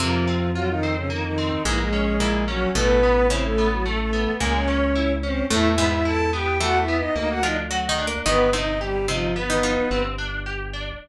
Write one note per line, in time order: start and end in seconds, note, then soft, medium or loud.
0.00 1.52 F2 loud
0.00 0.70 C3 medium
0.00 0.51 F3 medium
0.00 0.25 A#3 loud
0.00 0.70 C4 loud
0.00 0.51 F4 medium
0.27 0.52 C4 medium
0.55 0.68 F#3 medium
0.55 0.80 F4 medium
0.55 0.68 F#4 medium
0.69 0.95 D#3 medium
0.69 0.95 D#4 medium
0.83 1.08 C4 medium
0.96 1.09 C#3 medium
0.96 1.09 C#4 medium
1.10 1.23 D#3 medium
1.10 1.35 A#3 medium
1.10 1.23 D#4 medium
1.24 1.62 D#3 medium
1.24 1.62 D#4 medium
1.38 1.63 C4 medium
1.65 2.66 A#1 medium
1.65 2.15 G#2 loud
1.65 1.78 E3 medium
1.65 2.15 G#3 loud
1.65 1.90 A#3 medium
1.65 1.78 E4 medium
1.78 2.44 G#3 medium
1.78 2.44 G#4 medium
1.93 2.17 C#4 medium
2.20 2.70 A#2 medium
2.20 2.70 A#3 medium
2.20 2.45 E4 medium
2.48 2.70 F#3 medium
2.48 2.72 C#4 medium
2.48 2.70 F#4 medium
2.75 4.27 A1 loud
2.75 3.22 B2 loud
2.75 3.00 A3 loud
2.75 3.22 B3 loud
2.75 3.26 B3 medium
2.75 3.26 B4 loud
3.03 3.28 B3 medium
3.30 4.29 C#3 medium
3.30 3.43 C4 medium
3.30 4.29 C#4 loud
3.30 3.55 E4 medium
3.30 3.43 C5 medium
3.44 3.68 A3 medium
3.44 3.68 A4 medium
3.58 3.83 B3 medium
3.72 3.85 F#3 medium
3.72 3.85 F#4 medium
3.85 4.10 A3 medium
3.85 3.98 A3 medium
3.85 3.98 A4 medium
3.99 4.32 A3 medium
3.99 4.32 A4 medium
4.13 4.38 B3 medium
4.40 5.42 C#2 loud
4.40 5.38 A#2 medium
4.40 4.65 G#3 loud
4.40 4.53 A#3 medium
4.40 5.38 A#3 loud
4.40 4.53 A#4 medium
4.54 5.13 C#4 medium
4.54 5.13 C#5 medium
4.68 4.92 C#4 medium
4.95 5.20 E4 medium
5.23 5.45 C4 medium
5.23 5.48 C#4 medium
5.23 5.45 C5 medium
5.50 7.03 E2 medium
5.50 5.75 A2 loud
5.50 5.75 A3 medium
5.50 5.75 A3 loud
5.50 5.68 E4 medium
5.50 5.68 E5 medium
5.69 5.86 E4 medium
5.69 5.86 E5 medium
5.78 6.47 G#2 medium
5.78 6.47 G#3 loud
5.78 6.03 B3 medium
5.87 6.04 E4 medium
5.87 6.04 E5 medium
6.05 6.30 E4 medium
6.05 6.31 A4 medium
6.05 6.31 A5 medium
6.33 6.58 B3 medium
6.33 6.58 G4 medium
6.33 6.58 G5 medium
6.60 7.32 E3 medium
6.60 6.85 A3 medium
6.60 7.32 E4 loud
6.60 6.78 F#4 medium
6.60 6.78 F#5 medium
6.79 6.96 E4 medium
6.79 6.96 E5 medium
6.88 7.13 B3 medium
6.97 7.15 D#4 medium
6.97 7.15 D#5 medium
7.15 8.17 D2 medium
7.15 7.40 A#3 loud
7.15 7.28 D#4 medium
7.15 7.28 D#5 medium
7.29 7.42 F#4 medium
7.29 7.42 F#5 medium
7.43 7.67 F3 medium
7.43 7.68 D4 medium
7.43 7.56 D#4 medium
7.43 7.67 F4 loud
7.43 7.56 D#5 medium
7.71 7.88 F#3 medium
7.71 7.88 F#4 medium
7.71 7.95 F#4 medium
7.89 8.06 D#3 medium
7.89 8.06 D#4 loud
7.98 8.23 D4 medium
8.07 8.25 A#3 medium
8.07 8.25 A#4 loud
8.26 9.78 G1 loud
8.26 8.49 D#3 loud
8.26 8.50 B3 medium
8.26 8.51 B3 loud
8.26 8.49 D#4 loud
8.26 8.50 B4 medium
8.53 9.05 C3 medium
8.53 9.05 C4 medium
8.53 8.78 D#4 medium
8.53 8.79 D#4 medium
8.53 8.79 D#5 medium
8.81 9.07 G3 medium
8.81 9.06 G4 medium
8.81 9.07 G4 medium
9.08 9.34 C3 medium
9.08 9.35 F3 medium
9.08 9.34 C4 loud
9.08 9.33 D#4 medium
9.08 9.35 F4 medium
9.35 10.02 B3 medium
9.35 9.61 B3 medium
9.35 10.02 B4 medium
9.50 9.63 D#3 medium
9.50 9.63 D#4 loud
9.63 10.07 F3 medium
9.63 9.88 D#4 medium
9.63 10.07 F4 loud
9.91 10.92 G1 loud
9.91 10.16 C4 loud
10.18 10.43 D4 medium
10.46 10.71 G4 medium
10.73 10.98 D4 medium